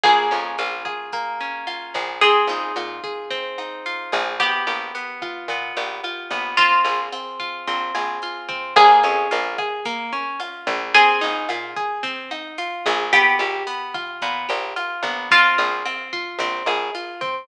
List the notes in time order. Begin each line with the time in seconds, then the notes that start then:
0.03 A#1 A#3 G#4, kick, cross-stick, closed hi-hat
0.31 F2 C#4, snare, closed hi-hat
0.58 A#1 F4, closed hi-hat
0.85 G#4, kick, cross-stick, closed hi-hat
1.12 A#3, kick, closed hi-hat
1.40 C#4, closed hi-hat
1.67 F4, cross-stick, closed hi-hat
1.94 A#1 G#4, kick, closed hi-hat
2.21 C4 G#4, kick, closed hi-hat
2.47 A#1 D#4, snare, closed hi-hat
2.76 A#2 F4, cross-stick, closed hi-hat
3.04 G#4, kick, closed hi-hat
3.30 C4, kick, closed hi-hat
3.58 D#4, cross-stick, closed hi-hat
3.86 F4, closed hi-hat
4.12 A#1 G#4, kick, closed hi-hat
4.40 B3 G4, kick, cross-stick, closed hi-hat
4.67 A#1 G4, snare, closed hi-hat
4.95 B3, closed hi-hat
5.22 F4, kick, cross-stick, closed hi-hat
5.48 A#2 B3, kick, closed hi-hat
5.76 A#1 G4, closed hi-hat
6.04 F4, cross-stick, closed hi-hat
6.30 A#1 B3, kick, closed hi-hat
6.57 C4 F4, kick, closed hi-hat
6.84 A#1 G#4, snare, closed hi-hat
7.12 C4, cross-stick, closed hi-hat
7.40 F4, kick, closed hi-hat
7.67 A#1 C4, kick, closed hi-hat
7.95 A#1 G#4, cross-stick, closed hi-hat
8.22 F4, closed hi-hat
8.48 C4, kick, closed hi-hat
8.76 A#1 A#3 G#4, kick, cross-stick, closed hi-hat
9.03 F2 C#4, snare, closed hi-hat
9.31 A#1 F4, closed hi-hat
9.58 G#4, kick, cross-stick, closed hi-hat
9.85 A#3, kick, closed hi-hat
10.13 C#4, closed hi-hat
10.40 F4, cross-stick, closed hi-hat
10.67 A#1 G#4, kick, closed hi-hat
10.94 C4 G#4, kick, closed hi-hat
11.21 A#1 D#4, snare, closed hi-hat
11.49 A#2 F4, cross-stick, closed hi-hat
11.76 G#4, kick, closed hi-hat
12.03 C4, kick, closed hi-hat
12.31 D#4, cross-stick, closed hi-hat
12.58 F4, closed hi-hat
12.86 A#1 G#4, kick, closed hi-hat
13.13 B3 G4, kick, cross-stick, closed hi-hat
13.39 A#1 G4, snare, closed hi-hat
13.67 B3, closed hi-hat
13.94 F4, kick, cross-stick, closed hi-hat
14.22 A#2 B3, kick, closed hi-hat
14.49 A#1 G4, closed hi-hat
14.76 F4, cross-stick, closed hi-hat
15.03 A#1 B3, kick, closed hi-hat
15.31 C4 F4, kick, closed hi-hat
15.58 A#1 G#4, snare, closed hi-hat
15.85 C4, cross-stick, closed hi-hat
16.13 F4, kick, closed hi-hat
16.39 A#1 C4, kick, closed hi-hat
16.66 A#1 G#4, cross-stick, closed hi-hat
16.95 F4, closed hi-hat
17.21 C4, kick, closed hi-hat